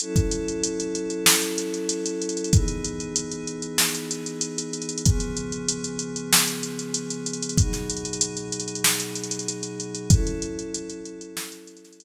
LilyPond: <<
  \new Staff \with { instrumentName = "Pad 5 (bowed)" } { \time 4/4 \key fis \dorian \tempo 4 = 95 <fis cis' e' a'>1 | <e b dis' gis'>1 | <cis eis b gis'>1 | <b, fis dis' gis'>1 |
<fis cis' e' a'>1 | }
  \new DrumStaff \with { instrumentName = "Drums" } \drummode { \time 4/4 hh16 <hh bd>16 hh16 hh16 hh16 hh16 hh16 hh16 sn16 hh16 hh16 hh16 hh16 hh16 hh32 hh32 hh32 hh32 | <hh bd>16 hh16 hh16 hh16 hh16 hh16 hh16 hh16 sn16 hh16 hh16 hh16 hh16 hh16 hh32 hh32 hh32 hh32 | <hh bd>16 hh16 hh16 hh16 hh16 hh16 hh16 hh16 sn16 hh16 hh16 hh16 hh16 hh16 hh32 hh32 hh32 hh32 | <hh bd>16 <hh sn>16 hh32 hh32 hh32 hh32 hh16 hh16 hh32 hh32 hh32 hh32 sn16 hh16 hh32 hh32 hh32 hh32 hh16 hh16 hh16 hh16 |
<hh bd>16 hh16 hh16 hh16 hh16 hh16 hh16 hh16 sn16 hh16 hh32 hh32 <hh sn>32 hh32 hh4 | }
>>